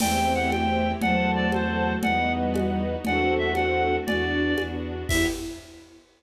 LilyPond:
<<
  \new Staff \with { instrumentName = "Clarinet" } { \time 6/8 \key e \minor \tempo 4. = 118 g''4 fis''8 g''4. | fis''4 d''8 c''4. | fis''4 r2 | fis''4 e''8 fis''4. |
d''2 r4 | e''4. r4. | }
  \new Staff \with { instrumentName = "Ocarina" } { \time 6/8 \key e \minor <a c'>2. | <fis a>2. | <g b>2. | <d' fis'>2. |
fis'8 d'4 r4. | e'4. r4. | }
  \new Staff \with { instrumentName = "String Ensemble 1" } { \time 6/8 \key e \minor <c'' e'' g''>2. | <c'' fis'' a''>2. | <b' dis'' fis''>2. | <a' c'' fis''>2. |
<b d' fis'>4. <b d' fis'>4. | <b e' g'>4. r4. | }
  \new Staff \with { instrumentName = "Violin" } { \clef bass \time 6/8 \key e \minor e,2. | e,2. | e,2. | e,2. |
e,4. e,4. | e,4. r4. | }
  \new Staff \with { instrumentName = "String Ensemble 1" } { \time 6/8 \key e \minor <c' e' g'>2. | <c' fis' a'>2. | <b dis' fis'>2. | <a c' fis'>2. |
<b d' fis'>2. | <b e' g'>4. r4. | }
  \new DrumStaff \with { instrumentName = "Drums" } \drummode { \time 6/8 <cgl cb cymc>4. <cgho cb>4. | <cgl cb>4. <cgho cb>4. | <cgl cb>4. <cgho cb>4. | <cgl cb>4. <cgho cb>4. |
<cgl cb>4. <cgho cb>4. | <cymc bd>4. r4. | }
>>